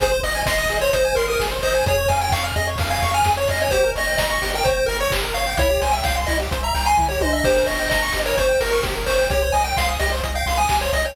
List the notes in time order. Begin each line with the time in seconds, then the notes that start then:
0.00 G#1 G#4 C5, kick, closed hi-hat
0.12 C5
0.23 G#1 D#5, open hi-hat
0.35 G#5
0.46 G#1 D#5 C6, kick, snare
0.58 D#6
0.69 G#1 G#4, open hi-hat
0.81 C5 C#5
0.93 G#1 C5 D#5, kick, closed hi-hat
1.05 G#5
1.15 G#1 A#4 C6, open hi-hat
1.28 A#4 D#6
1.39 G#1 G#4, kick, snare
1.51 C5
1.62 G#1 C5 D#5, open hi-hat
1.74 G#5
1.86 F2 G#4 C#5, kick, closed hi-hat
1.98 C#5
2.08 F2 F5 G#5, open hi-hat
2.21 G5 G#5
2.31 F2 F5 C#6, kick, clap
2.44 F6
2.56 F2 G#4 D#5
2.67 C#5
2.78 F2 F5, kick, open hi-hat
2.90 F5 G#5
3.02 F2 C#6, open hi-hat
3.14 G#5 F6
3.24 F2 G#4, kick, snare
3.37 C#5
3.48 F2 D#5 F5, open hi-hat
3.60 C#5 G#5
3.71 G1 G4 C5, kick, closed hi-hat
3.84 A#4
3.95 G1 C#5 D#5, open hi-hat
4.07 G5
4.17 G1 D#5 A#5, kick, snare
4.30 C#6
4.42 G1 G4, open hi-hat
4.54 A#4 G5
4.64 G1 C5 C#5, kick, closed hi-hat
4.77 G5
4.86 G1 A#4 A#5, open hi-hat
5.00 C#5 C#6
5.10 G1 G4, kick, clap
5.23 A#4
5.34 G1 C#5 F5, open hi-hat
5.47 G5
5.57 C2 E4 C#5, kick, closed hi-hat
5.70 G4
5.81 C2 C5 G#5, open hi-hat
5.91 E5 G5
6.04 C2 F5 G5, kick, snare
6.16 C6
6.27 C2 E4 D#5, open hi-hat
6.40 G4
6.51 C2 C5, kick, closed hi-hat
6.63 E5 A#5
6.74 C2 G5, open hi-hat
6.86 G#5 C6
6.97 C2 E4, kick, floor tom
7.09 G4 C#5
7.21 C2 C5 D#5, high tom
7.33 D#5 E5
7.44 G1 G4 C5, kick, crash
7.56 A#4
7.66 G1 C#5 D#5, open hi-hat
7.79 G5
7.90 G1 D#5 A#5, kick, snare
8.02 C#6
8.12 G1 G4, open hi-hat
8.25 A#4 C#5
8.37 G1 C5 C#5, kick, closed hi-hat
8.49 G5
8.60 G1 A#4 A#5, open hi-hat
8.71 A#4 C#6
8.83 G1 G4, kick, snare
8.95 A#4
9.06 G1 C5 C#5, open hi-hat
9.19 G5
9.30 C2 G4 C#5, kick, closed hi-hat
9.42 C5
9.52 C2 D#5 G#5, open hi-hat
9.64 G5
9.77 C2 F5 C6, kick, snare
9.88 D#6
9.99 C2 G4 D#5, open hi-hat
10.12 C5
10.23 C2 D#5, kick, closed hi-hat
10.35 F5 G5
10.46 C2 C6, open hi-hat
10.57 G#5 D#6
10.69 C2 G4, kick, clap
10.81 C5 C#5
10.93 C2 D#5, open hi-hat
11.05 C#5 G5